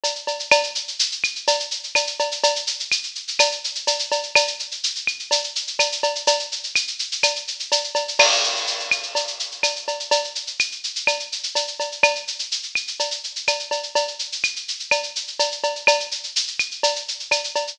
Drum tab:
CC |----|----------------|----------------|----------------|
SH |xxxx|xxxxxxxxxxxxxxxx|xxxxxxxxxxxxxxxx|xxxxxxxxxxxxxxxx|
CB |x-x-|x-------x---x-x-|x-------x---x-x-|x-------x---x-x-|
CL |----|x-----x-----x---|----x---x-------|x-----x-----x---|

CC |----------------|x---------------|----------------|----------------|
SH |xxxxxxxxxxxxxxxx|-xxxxxxxxxxxxxxx|xxxxxxxxxxxxxxxx|xxxxxxxxxxxxxxxx|
CB |x-------x---x-x-|x-------x---x-x-|x-------x---x-x-|x-------x---x-x-|
CL |----x---x-------|x-----x-----x---|----x---x-------|x-----x-----x---|

CC |----------------|----------------|
SH |xxxxxxxxxxxxxxxx|xxxxxxxxxxxxxxxx|
CB |x-------x---x-x-|x-------x---x-x-|
CL |----x---x-------|x-----x-----x---|